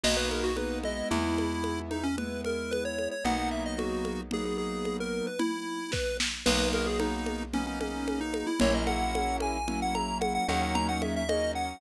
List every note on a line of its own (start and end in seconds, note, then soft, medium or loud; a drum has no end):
0.03 1.03 B1 medium
0.03 0.52 A#3 medium
0.03 0.52 B3 medium
0.03 0.52 D#4 medium
0.03 0.52 F#4 medium
0.03 0.17 D#5 medium
0.03 crash loud
0.03 low conga medium
0.17 0.29 B4 medium
0.31 0.44 A#4 medium
0.31 high conga medium
0.44 0.56 F#4 medium
0.56 0.82 A#3 medium
0.56 0.82 B3 medium
0.56 0.82 D#4 medium
0.56 0.82 F#4 medium
0.56 0.79 B4 medium
0.56 high conga medium
0.83 2.07 G#3 medium
0.83 2.07 B3 medium
0.83 2.07 E4 medium
0.83 1.09 D#5 medium
0.83 high conga medium
1.11 3.08 E2 medium
1.11 1.80 E4 medium
1.11 low conga medium
1.38 high conga medium
1.64 high conga medium
1.91 2.04 D#4 medium
1.91 high conga medium
2.03 2.16 C#4 medium
2.18 3.14 G#3 medium
2.18 3.14 B3 medium
2.18 3.14 E4 medium
2.18 2.41 B4 medium
2.18 low conga medium
2.44 2.71 A#4 medium
2.44 high conga medium
2.71 2.84 B4 medium
2.71 high conga medium
2.85 3.09 C#5 medium
2.98 high conga medium
3.11 3.24 C#5 medium
3.24 5.22 B1 medium
3.24 4.21 F#3 medium
3.24 4.21 A#3 medium
3.24 4.21 B3 medium
3.24 4.21 D#4 medium
3.24 3.50 F#5 medium
3.24 low conga medium
3.51 3.64 E5 medium
3.66 3.78 D#5 medium
3.78 4.21 F#4 medium
3.78 high conga medium
4.05 high conga medium
4.31 5.28 F#3 medium
4.31 5.28 A#3 medium
4.31 5.28 B3 medium
4.31 5.28 D#4 medium
4.31 4.45 G#4 medium
4.31 low conga medium
4.45 4.57 G#4 medium
4.58 4.97 G#4 medium
4.85 high conga medium
5.00 5.26 A#4 medium
5.27 5.40 B4 medium
5.39 5.91 E4 medium
5.39 low conga medium
5.92 6.17 B4 medium
5.92 kick medium
5.92 snare medium
6.20 snare medium
6.46 8.44 B1 medium
6.46 7.43 F#3 loud
6.46 7.43 A#3 medium
6.46 7.43 B3 medium
6.46 7.43 D#4 medium
6.46 6.69 B4 medium
6.46 crash loud
6.46 low conga medium
6.73 6.86 A#4 medium
6.73 high conga medium
6.87 6.99 G#4 medium
7.00 7.43 D#4 medium
7.00 high conga medium
7.26 high conga medium
7.53 8.50 F#3 medium
7.53 8.50 A#3 medium
7.53 8.50 B3 medium
7.53 7.66 C#4 medium
7.53 8.50 D#4 medium
7.53 low conga medium
7.67 7.79 C#4 medium
7.81 8.20 C#4 medium
7.81 high conga medium
8.08 high conga medium
8.21 8.47 D#4 medium
8.34 high conga medium
8.47 8.59 E4 medium
8.60 10.39 A#1 loud
8.60 9.57 F#3 medium
8.60 9.57 A#3 loud
8.60 9.57 C#4 medium
8.60 9.57 E4 loud
8.60 8.73 C#5 medium
8.60 low conga loud
8.74 8.87 D#5 medium
8.87 9.37 F#5 medium
8.87 high conga medium
9.15 high conga medium
9.40 9.80 G#5 medium
9.40 high conga medium
9.68 10.44 F#3 medium
9.68 10.44 A#3 medium
9.68 10.44 C#4 medium
9.68 10.44 E4 medium
9.68 low conga medium
9.82 9.95 F#5 medium
9.95 10.18 A#5 medium
9.95 high conga medium
10.21 10.33 F#5 medium
10.21 high conga medium
10.35 10.47 F#5 medium
10.48 11.74 D#2 medium
10.48 11.23 F#3 medium
10.48 11.23 A#3 medium
10.48 11.23 C#4 loud
10.48 11.23 D#4 medium
10.48 10.62 F#5 medium
10.48 high conga medium
10.63 10.75 F#5 medium
10.75 10.87 A#5 medium
10.75 low conga medium
10.89 11.01 F#5 medium
11.02 11.15 E5 medium
11.02 high conga medium
11.16 11.29 E5 medium
11.29 11.77 F#3 medium
11.29 11.77 A#3 medium
11.29 11.77 C#4 medium
11.29 11.77 D#4 medium
11.29 11.52 D#5 medium
11.29 high conga medium
11.55 11.81 F#5 medium